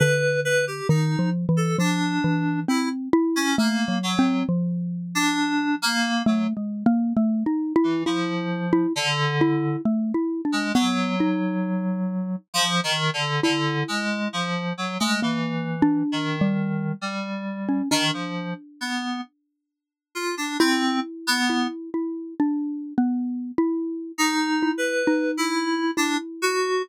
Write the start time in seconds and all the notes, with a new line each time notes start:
0.00 D3 B4
0.45 B4
0.67 G4
0.89 D#3 D#4
1.19 F3
1.49 E3
1.57 A4
1.79 F3 D4
2.24 E3
2.68 C4 E4
3.13 E4
3.36 C#4
3.58 A3 A#3
3.88 F#3
4.03 F#3
4.19 C4
4.49 F3
5.15 D4
5.82 A#3
6.26 F#3 A3
6.57 G#3
6.86 A#3
7.17 A3
7.46 D#4
7.76 E4
7.84 E3
8.06 F3 E4
8.73 E4
8.96 D3
9.41 E4
9.85 A3
10.14 E4
10.45 D4
10.52 G#3
10.75 F#3 B3
11.20 D#4
12.54 F3
12.84 D#3
13.13 D3
13.43 D3 E4
13.88 G#3
14.33 F3
14.78 F#3
15.00 G#3 A3
15.22 E3 A#3
15.82 D4
16.12 D#3
16.41 G3
17.01 G3
17.69 C#4
17.91 D#3 D4
18.13 F3
18.81 B3
20.15 F4
20.37 D4
20.60 C4 E4
21.27 B3
21.50 E4
21.94 E4
22.40 D4
22.98 B3
23.58 E4
24.18 D#4
24.62 E4
24.78 B4
25.07 D#4
25.37 E4
25.97 D4 E4
26.42 F#4